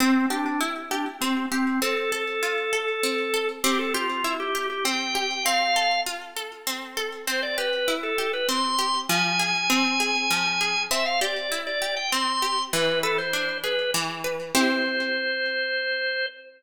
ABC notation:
X:1
M:3/4
L:1/16
Q:1/4=99
K:C
V:1 name="Drawbar Organ"
C2 D D z2 D z C2 C2 | A12 | G A F3 G2 G g4 | f4 z8 |
c d B3 A2 B c'4 | _a12 | e f d3 d2 g c'4 | B2 A c3 B2 z4 |
c12 |]
V:2 name="Orchestral Harp"
C2 G2 E2 G2 C2 G2 | C2 A2 F2 A2 C2 A2 | C2 G2 E2 G2 C2 G2 | C2 A2 F2 A2 C2 A2 |
C2 G2 E2 G2 C2 G2 | F,2 _A2 C2 A2 F,2 A2 | C2 G2 E2 G2 C2 G2 | E,2 B2 D2 ^G2 E,2 B2 |
[CEG]12 |]